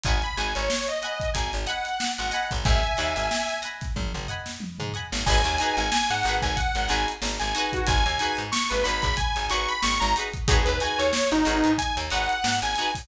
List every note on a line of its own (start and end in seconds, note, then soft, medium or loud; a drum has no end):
0.04 0.21 G#1 medium
0.04 0.18 D#5 medium
0.04 0.18 F#5 medium
0.04 0.22 G#5 medium
0.04 0.18 G#5 medium
0.04 kick medium
0.04 closed hi-hat medium
0.09 0.18 B5 medium
0.22 0.37 B5 medium
0.22 closed hi-hat medium
0.37 0.54 G#1 medium
0.37 0.62 D#5 medium
0.37 0.62 F#5 medium
0.37 0.54 G#5 medium
0.37 0.62 G#5 medium
0.37 0.62 B5 medium
0.37 closed hi-hat medium
0.55 0.69 G#1 medium
0.55 0.87 C#5 medium
0.55 closed hi-hat medium
0.70 snare loud
0.87 1.29 D#5 medium
0.87 snare soft
0.87 closed hi-hat medium
1.02 1.26 D#5 medium
1.02 1.26 F#5 medium
1.02 1.26 G#5 medium
1.02 1.26 B5 medium
1.02 closed hi-hat medium
1.20 kick medium
1.20 closed hi-hat medium
1.34 1.52 G#1 medium
1.34 1.51 G#5 medium
1.34 kick medium
1.34 closed hi-hat loud
1.53 1.67 G#1 medium
1.53 closed hi-hat medium
1.66 1.90 D#5 medium
1.66 2.12 F#5 medium
1.66 1.90 F#5 medium
1.66 1.90 G#5 medium
1.66 1.90 B5 medium
1.66 closed hi-hat medium
1.85 closed hi-hat medium
2.00 snare loud
2.18 2.32 G#1 medium
2.18 2.47 F#5 medium
2.18 closed hi-hat medium
2.31 2.77 D#5 medium
2.31 2.77 F#5 medium
2.31 2.77 G#5 medium
2.31 2.77 B5 medium
2.31 snare soft
2.31 closed hi-hat medium
2.51 2.64 G#1 medium
2.51 kick medium
2.51 closed hi-hat medium
2.65 2.82 G#1 loud
2.65 3.58 E5 medium
2.65 3.58 G#5 medium
2.65 kick loud
2.65 closed hi-hat medium
2.83 closed hi-hat medium
2.97 3.15 D#2 medium
2.97 3.21 D#5 medium
2.97 3.21 F#5 medium
2.97 3.21 G#5 medium
2.97 3.21 B5 medium
2.97 snare soft
2.97 closed hi-hat medium
3.16 3.29 G#1 medium
3.16 closed hi-hat medium
3.31 snare medium
3.49 snare soft
3.49 closed hi-hat medium
3.62 3.86 D#5 medium
3.62 3.86 F#5 medium
3.62 3.86 G#5 medium
3.62 3.86 B5 medium
3.62 closed hi-hat medium
3.81 kick medium
3.81 snare soft
3.81 closed hi-hat medium
3.96 4.13 G#1 medium
3.96 kick medium
3.96 high tom medium
4.14 4.27 G#1 medium
4.14 mid tom medium
4.28 4.52 D#5 medium
4.28 4.52 F#5 medium
4.28 4.52 G#5 medium
4.28 4.52 B5 medium
4.28 floor tom medium
4.46 snare medium
4.60 high tom medium
4.79 4.93 G#2 medium
4.79 mid tom medium
4.93 5.07 D#5 medium
4.93 5.07 F#5 medium
4.93 5.07 G#5 medium
4.93 5.07 B5 medium
4.93 floor tom medium
5.12 5.25 G#1 medium
5.12 snare medium
5.26 5.43 G#1 medium
5.26 5.40 D#4 medium
5.26 5.40 F#4 medium
5.26 5.40 G#4 medium
5.26 5.40 B4 medium
5.26 5.75 G#5 loud
5.26 kick medium
5.26 crash loud
5.44 5.58 D#2 medium
5.44 snare soft
5.44 closed hi-hat medium
5.58 5.84 D#4 medium
5.58 5.84 F#4 medium
5.58 5.84 G#4 medium
5.58 snare soft
5.58 closed hi-hat medium
5.63 5.84 B4 medium
5.77 5.90 G#1 medium
5.77 5.91 G#5 loud
5.77 closed hi-hat medium
5.92 6.09 G#5 loud
5.92 snare loud
6.10 6.23 G#2 medium
6.10 6.36 F#5 loud
6.10 closed hi-hat medium
6.23 6.41 G#1 medium
6.23 6.50 D#4 medium
6.23 6.50 F#4 medium
6.23 closed hi-hat medium
6.28 6.50 G#4 medium
6.28 6.50 B4 medium
6.42 6.56 G#1 medium
6.42 6.56 G#5 loud
6.42 kick medium
6.42 closed hi-hat medium
6.56 6.88 F#5 loud
6.56 kick medium
6.56 closed hi-hat medium
6.75 6.88 G#1 medium
6.75 closed hi-hat medium
6.88 7.06 G#1 medium
6.88 7.13 D#4 medium
6.88 7.13 F#4 medium
6.88 7.13 G#4 medium
6.88 7.13 B4 medium
6.88 7.07 G#5 loud
6.88 closed hi-hat medium
7.08 closed hi-hat medium
7.22 7.39 G#1 medium
7.22 snare medium
7.39 7.54 G#1 medium
7.39 7.68 G#5 loud
7.39 closed hi-hat medium
7.55 8.00 D#4 medium
7.55 8.00 F#4 medium
7.55 8.00 G#4 medium
7.55 8.00 B4 medium
7.55 closed hi-hat medium
7.73 7.88 F#4 loud
7.73 kick medium
7.73 closed hi-hat medium
7.87 8.04 G#1 medium
7.87 8.04 G#5 loud
7.87 kick loud
7.87 closed hi-hat loud
8.05 8.19 D#2 medium
8.05 8.35 G#5 loud
8.05 closed hi-hat medium
8.19 8.44 D#4 medium
8.19 8.44 F#4 medium
8.19 8.44 G#4 medium
8.19 8.44 B4 medium
8.19 closed hi-hat medium
8.37 8.51 G#2 medium
8.37 closed hi-hat medium
8.52 8.69 C#6 loud
8.52 snare loud
8.70 8.84 G#1 medium
8.70 8.83 B4 loud
8.70 closed hi-hat medium
8.84 9.02 G#1 medium
8.84 9.08 D#4 medium
8.84 9.08 F#4 medium
8.84 9.08 G#4 medium
8.84 9.08 B4 medium
8.84 9.01 B5 loud
8.84 snare soft
8.84 closed hi-hat medium
9.02 9.16 G#1 medium
9.02 9.16 B5 loud
9.02 kick medium
9.02 closed hi-hat medium
9.17 9.46 G#5 loud
9.17 kick medium
9.17 closed hi-hat medium
9.36 9.49 G#1 medium
9.36 closed hi-hat medium
9.49 9.67 G#1 medium
9.49 9.73 D#4 medium
9.49 9.73 F#4 medium
9.49 9.73 G#4 medium
9.49 9.73 B4 medium
9.49 9.68 C#6 loud
9.49 closed hi-hat medium
9.68 9.82 B5 loud
9.68 closed hi-hat medium
9.82 10.00 G#1 medium
9.82 10.00 C#6 loud
9.82 snare loud
10.00 10.14 G#1 medium
10.00 10.14 A#5 loud
10.00 closed hi-hat medium
10.15 10.29 D#4 medium
10.15 10.29 F#4 medium
10.15 10.29 G#4 medium
10.15 snare soft
10.15 closed hi-hat medium
10.20 10.29 B4 medium
10.34 kick medium
10.34 closed hi-hat medium
10.48 10.65 G#1 medium
10.48 10.61 D#4 medium
10.48 10.61 F#4 medium
10.48 10.65 G#4 loud
10.48 10.61 G#4 medium
10.48 10.61 B4 medium
10.48 kick loud
10.48 closed hi-hat loud
10.65 10.80 D#2 medium
10.65 10.79 B4 loud
10.65 closed hi-hat medium
10.80 11.04 D#4 medium
10.80 11.04 F#4 medium
10.80 11.04 G#4 medium
10.80 11.04 B4 medium
10.80 10.99 G#5 loud
10.80 closed hi-hat medium
10.98 11.12 D#2 medium
10.98 11.30 C#5 loud
10.98 snare soft
10.98 closed hi-hat medium
11.13 snare loud
11.32 11.45 G#1 medium
11.32 11.73 D#4 loud
11.32 closed hi-hat medium
11.45 11.63 G#1 medium
11.45 11.69 D#4 medium
11.45 11.69 F#4 medium
11.45 11.69 G#4 medium
11.45 11.69 B4 medium
11.45 closed hi-hat medium
11.64 11.77 G#2 medium
11.64 closed hi-hat medium
11.78 11.96 G#5 loud
11.78 kick medium
11.78 closed hi-hat loud
11.97 12.10 D#2 medium
11.97 closed hi-hat medium
12.10 12.28 G#1 medium
12.10 12.35 D#4 medium
12.10 12.35 F#4 medium
12.10 12.35 G#4 medium
12.10 12.35 B4 medium
12.10 12.56 F#5 loud
12.10 closed hi-hat medium
12.29 closed hi-hat medium
12.44 12.61 G#2 medium
12.44 snare loud
12.62 12.75 G#1 medium
12.62 12.91 G#5 loud
12.62 closed hi-hat medium
12.76 12.91 D#4 medium
12.76 12.91 F#4 medium
12.76 closed hi-hat medium
12.80 12.91 G#4 medium
12.80 12.91 B4 medium
12.95 kick medium
12.95 open hi-hat medium